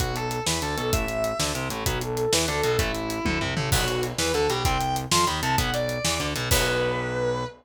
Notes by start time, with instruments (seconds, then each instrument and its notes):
0.00 synth bass 1 B1, overdriven guitar F#3 B3, distortion guitar F#4, kick, closed hi-hat
0.16 distortion guitar A4, closed hi-hat
0.31 closed hi-hat
0.46 synth bass 1 E2, overdriven guitar E3, distortion guitar B4, snare
0.62 synth bass 1 D2, overdriven guitar D3, distortion guitar A4, closed hi-hat
0.77 synth bass 1 B1, overdriven guitar B2, distortion guitar A4, closed hi-hat
0.93 synth bass 1 A1, overdriven guitar E3 A3, distortion guitar E5, kick, closed hi-hat
1.08 closed hi-hat
1.24 closed hi-hat
1.39 synth bass 1 D2, overdriven guitar D3, snare
1.55 synth bass 1 C2, overdriven guitar C3, closed hi-hat
1.70 synth bass 1 A1, overdriven guitar A2, closed hi-hat
1.86 synth bass 1 B1, overdriven guitar F#3 B3, distortion guitar F#4, kick, closed hi-hat
2.01 distortion guitar A4, closed hi-hat
2.17 closed hi-hat
2.33 synth bass 1 E2, overdriven guitar E3, distortion guitar B4, snare
2.48 synth bass 1 D2, overdriven guitar D3, distortion guitar A4, closed hi-hat
2.64 synth bass 1 B1, overdriven guitar B2, distortion guitar A4, closed hi-hat
2.79 synth bass 1 A1, overdriven guitar E3 A3, distortion guitar E4, kick, closed hi-hat
2.95 closed hi-hat
3.10 closed hi-hat
3.25 synth bass 1 D2, overdriven guitar D3, kick, high tom
3.41 synth bass 1 C2, overdriven guitar C3, floor tom
3.57 synth bass 1 A1, overdriven guitar A2, mid tom
3.72 synth bass 1 B1, overdriven guitar F#3 B3, distortion guitar F#4, kick, crash
3.88 closed hi-hat
4.03 closed hi-hat
4.18 synth bass 1 E2, overdriven guitar E3, distortion guitar B4, snare
4.34 synth bass 1 D2, overdriven guitar D3, distortion guitar A4, closed hi-hat
4.49 synth bass 1 B1, overdriven guitar B2, distortion guitar G4, closed hi-hat
4.65 synth bass 1 C2, overdriven guitar G3 C4, distortion guitar G5, kick, closed hi-hat
4.81 closed hi-hat
4.96 closed hi-hat
5.11 synth bass 1 F2, overdriven guitar F3, distortion guitar C6, snare
5.27 synth bass 1 D#2, overdriven guitar D#3, distortion guitar B5, closed hi-hat
5.42 synth bass 1 C2, overdriven guitar C3, distortion guitar A5, closed hi-hat
5.58 synth bass 1 B1, overdriven guitar F#3 B3, distortion guitar F#5, kick, closed hi-hat
5.74 distortion guitar D5, closed hi-hat
5.89 closed hi-hat
6.05 synth bass 1 E2, overdriven guitar E3, snare
6.20 synth bass 1 D2, overdriven guitar D3, closed hi-hat
6.36 synth bass 1 B1, overdriven guitar B2, closed hi-hat
6.51 synth bass 1 B1, overdriven guitar F#3 B3, distortion guitar B4, kick, crash